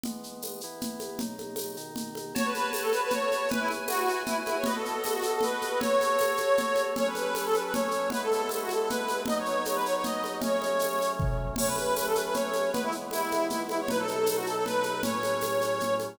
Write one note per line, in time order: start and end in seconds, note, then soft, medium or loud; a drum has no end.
0.03 0.62 E3 medium
0.03 0.62 G#3 medium
0.03 0.62 B3 medium
0.03 low conga medium
0.03 shaker medium
0.23 shaker medium
0.42 tambourine medium
0.42 high conga medium
0.42 shaker medium
0.61 1.21 E3 medium
0.61 1.21 B3 medium
0.61 1.21 E4 medium
0.61 shaker medium
0.81 low conga medium
0.81 shaker medium
1.00 high conga medium
1.00 shaker medium
1.19 1.76 B2 medium
1.19 1.77 F#3 medium
1.19 1.76 D#4 medium
1.19 low conga medium
1.19 shaker medium
1.38 high conga medium
1.38 shaker medium
1.56 tambourine medium
1.56 high conga medium
1.56 shaker medium
1.77 2.34 B2 medium
1.77 2.34 D#3 medium
1.77 2.34 D#4 medium
1.77 shaker medium
1.96 low conga medium
1.96 shaker medium
2.15 high conga medium
2.15 shaker medium
2.35 3.49 F#4 medium
2.35 3.49 C#5 loud
2.35 2.45 C#5 loud
2.35 3.49 A5 medium
2.35 low conga loud
2.35 shaker medium
2.45 2.54 B4 medium
2.54 2.70 B4 medium
2.54 high conga medium
2.54 shaker medium
2.73 2.82 B4 medium
2.73 tambourine medium
2.73 high conga medium
2.73 shaker medium
2.82 2.91 A4 medium
2.92 3.01 B4 medium
2.92 high conga medium
2.92 shaker medium
3.03 3.12 B4 medium
3.10 3.48 C#5 medium
3.10 low conga medium
3.10 shaker medium
3.32 high conga medium
3.32 shaker medium
3.48 4.65 E4 medium
3.48 4.65 B4 loud
3.48 3.60 B4 medium
3.48 4.65 G#5 medium
3.48 low conga loud
3.48 shaker medium
3.60 3.69 E4 medium
3.68 high conga medium
3.68 shaker medium
3.88 4.21 F#4 medium
3.88 tambourine medium
3.88 high conga medium
3.88 shaker medium
4.09 shaker medium
4.26 4.36 E4 medium
4.26 low conga medium
4.26 shaker medium
4.46 4.55 E4 medium
4.46 high conga medium
4.46 shaker medium
4.57 4.66 C#5 medium
4.64 5.81 B3 loud
4.64 5.79 F#4 medium
4.64 4.75 B4 medium
4.64 5.81 D#5 medium
4.64 low conga medium
4.64 shaker medium
4.75 4.84 A4 medium
4.84 5.02 A4 medium
4.84 shaker medium
5.03 5.12 A4 medium
5.03 tambourine medium
5.03 high conga medium
5.03 shaker medium
5.14 5.23 F#4 medium
5.22 5.32 A4 medium
5.22 high conga medium
5.22 shaker medium
5.33 5.43 A4 medium
5.41 5.80 B4 medium
5.41 low conga medium
5.41 shaker medium
5.62 high conga medium
5.62 shaker medium
5.80 6.94 F#4 medium
5.80 6.94 A4 medium
5.80 6.82 C#5 medium
5.80 6.94 C#5 medium
5.80 low conga medium
5.80 shaker medium
6.01 high conga medium
6.01 shaker medium
6.19 tambourine medium
6.19 high conga medium
6.19 shaker medium
6.37 high conga medium
6.37 shaker medium
6.57 low conga medium
6.57 shaker medium
6.76 high conga medium
6.76 shaker medium
6.96 8.10 F#3 medium
6.96 8.10 C#4 loud
6.96 8.10 A4 medium
6.96 7.06 C#5 medium
6.96 low conga medium
6.96 shaker medium
7.06 7.16 B4 medium
7.15 7.34 B4 medium
7.15 high conga medium
7.15 shaker medium
7.35 7.45 B4 medium
7.35 tambourine medium
7.35 high conga medium
7.35 shaker medium
7.45 7.54 A4 medium
7.54 7.63 B4 medium
7.54 high conga medium
7.54 shaker medium
7.64 7.73 B4 medium
7.73 8.07 C#5 medium
7.73 low conga medium
7.73 shaker medium
7.91 shaker medium
8.10 9.25 G#3 medium
8.10 9.25 B3 medium
8.10 9.25 E4 medium
8.10 8.22 B4 medium
8.10 low conga medium
8.10 shaker medium
8.22 8.31 A4 medium
8.32 8.48 A4 medium
8.32 high conga medium
8.32 shaker medium
8.49 8.61 A4 medium
8.49 tambourine medium
8.49 high conga medium
8.49 shaker medium
8.62 8.71 F#4 medium
8.69 8.79 A4 medium
8.69 high conga medium
8.69 shaker medium
8.80 8.89 A4 medium
8.89 9.21 B4 medium
8.89 low conga medium
8.89 shaker medium
9.08 high conga medium
9.08 shaker medium
9.26 10.40 F#3 medium
9.26 10.42 B3 medium
9.26 10.42 D#4 medium
9.26 9.36 D#5 medium
9.26 low conga medium
9.26 shaker medium
9.38 9.46 C#5 medium
9.46 9.63 C#5 medium
9.46 shaker medium
9.65 9.75 C#5 medium
9.65 tambourine medium
9.65 high conga medium
9.65 shaker medium
9.75 9.84 B4 medium
9.86 9.94 C#5 medium
9.86 shaker medium
9.95 10.04 C#5 medium
10.04 10.36 D#5 medium
10.04 low conga medium
10.04 shaker medium
10.24 high conga medium
10.24 shaker medium
10.41 11.55 F#3 medium
10.41 11.55 A3 medium
10.41 11.55 C#4 medium
10.41 11.10 C#5 medium
10.41 low conga medium
10.41 shaker medium
10.62 high conga medium
10.62 shaker medium
10.79 tambourine medium
10.79 high conga medium
10.79 shaker medium
10.99 high conga medium
10.99 shaker medium
11.19 kick medium
11.19 floor tom medium
11.56 12.72 F#3 medium
11.56 12.72 A3 medium
11.56 12.72 C#4 medium
11.56 11.66 C#5 medium
11.56 crash loud
11.56 low conga medium
11.56 shaker medium
11.67 11.76 B4 medium
11.76 11.95 B4 medium
11.76 high conga medium
11.76 shaker medium
11.96 12.06 B4 medium
11.96 tambourine medium
11.96 high conga medium
11.96 shaker medium
12.06 12.15 A4 medium
12.15 12.24 B4 medium
12.15 high conga medium
12.15 shaker medium
12.24 12.33 B4 medium
12.33 12.70 C#5 medium
12.33 low conga medium
12.33 shaker medium
12.53 high conga medium
12.53 shaker medium
12.73 13.88 E3 medium
12.73 13.88 G#3 medium
12.73 13.88 B3 medium
12.73 12.82 B4 medium
12.73 low conga medium
12.73 shaker medium
12.83 12.92 E4 medium
12.92 shaker medium
13.11 13.45 E4 medium
13.11 tambourine medium
13.11 high conga medium
13.11 shaker medium
13.31 high conga medium
13.31 shaker medium
13.50 13.60 E4 medium
13.50 low conga medium
13.50 shaker medium
13.69 13.78 E4 medium
13.69 high conga medium
13.69 shaker medium
13.80 13.89 C#5 medium
13.88 15.03 B2 medium
13.88 15.02 F#3 medium
13.88 15.03 D#4 medium
13.88 13.99 B4 medium
13.88 low conga medium
13.88 shaker medium
13.99 14.07 A4 medium
14.08 14.26 A4 medium
14.08 high conga medium
14.08 shaker medium
14.26 14.37 A4 medium
14.26 tambourine medium
14.26 high conga medium
14.26 shaker medium
14.37 14.46 F#4 medium
14.46 14.55 A4 medium
14.46 shaker medium
14.55 14.64 A4 medium
14.65 15.01 B4 medium
14.65 low conga medium
14.65 shaker medium
14.83 high conga medium
14.83 shaker medium
15.03 16.17 A2 medium
15.03 16.17 F#3 medium
15.03 16.17 C#4 medium
15.03 15.94 C#5 medium
15.03 low conga medium
15.03 shaker medium
15.23 high conga medium
15.23 shaker medium
15.41 tambourine medium
15.41 high conga medium
15.41 shaker medium
15.61 high conga medium
15.61 shaker medium
15.80 low conga medium
15.80 shaker medium
16.00 high conga medium
16.00 shaker medium